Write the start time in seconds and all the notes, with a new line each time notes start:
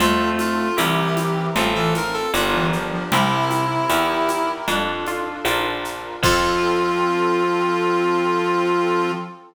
0.00 F2 A3 C4 F4 A4, low conga, shaker
0.39 F4, high conga, shaker
0.77 C2 E3 C4 E4 G4 A#4, tambourine, high conga, shaker
1.17 high conga, shaker
1.55 A1 C4 F4 A4, low conga, shaker
1.75 E3 A4
1.95 A#4, high conga, shaker
2.14 A4
2.34 G1 D4 F4 G4 A#4, tambourine, high conga, shaker
2.53 E3
2.73 F3, shaker
2.92 F3
3.11 C2 C3 C4 E4 G4 A#4, low conga, shaker
3.51 high conga, shaker
3.89 E2 E4 G4 A#4, tambourine, high conga, shaker
4.29 high conga, shaker
4.67 F2 D4 F4 A4, low conga, shaker
5.06 F4, high conga, shaker
5.45 A#1 D4 F4 A#4, tambourine, high conga, shaker
5.85 shaker
6.23 F2 F3 C4 F4 A4, kick, crash